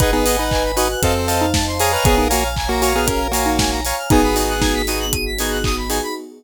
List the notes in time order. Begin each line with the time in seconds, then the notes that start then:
0.00 G#1 D#4 G#4 B4 D#5 F#5 G#5, kick, closed hi-hat
0.13 B3 D#4 G#4 B4
0.26 B4 D#5 F#5 G#5, open hi-hat
0.38 D#4 B4 F#5
0.51 G#5, kick, clap
0.64 B5
0.76 D#4 F#4 B4 D#5 F#5 G#5 D#6, open hi-hat
0.90 F#6
1.02 F2 C4 A4 C5 D#5 F5 A5, kick, closed hi-hat
1.15 C5
1.27 C5 D#5 F5 A5, open hi-hat
1.41 D#4 F5
1.54 A5, kick, snare
1.67 C6
1.79 G#4 C#5 F5 G#5 A#5 D#6, open hi-hat
1.92 B4 F6
2.04 A#1 B3 G#4 C#5 F5 G#5 A#5, kick, closed hi-hat
2.18 D#4 A#4
2.30 A#3 F#4 C#5 F5 G#5 A#5, open hi-hat
2.44 F5
2.56 G#5, kick, clap
2.69 A#3 F#4 A#5
2.82 F#4 C#5 F5 G#5 A#5 C#6, open hi-hat
2.95 B3 G#4 F6
3.07 C#4 G#4 A#4, kick, closed hi-hat
3.21 A#4
3.32 A#3 F#4 C#5 F5 G#5 A#5, open hi-hat
3.46 D#4 F5
3.59 G#5, kick, snare
3.71 A#5
3.85 C#5 F5 G#5 A#5 C#6, open hi-hat
3.98 F6
4.10 G#1 B3 D#4 F#4 G#4 G#5, kick, closed hi-hat
4.23 B5
4.36 B3 D#4 F#4 G#4 D#6, open hi-hat
4.49 F#6
4.61 D#4 G#6, kick, snare
4.74 B6
4.87 B3 D#4 F#4 G#4 D#7, open hi-hat
5.00 F#7
5.13 D#7, kick, closed hi-hat
5.26 B6
5.38 B3 D#4 F#4 G#4 G#6, open hi-hat
5.51 F#6
5.64 D#6, kick, clap
5.77 B5
5.89 B3 D#4 F#4 G#4 G#5, open hi-hat
6.03 B5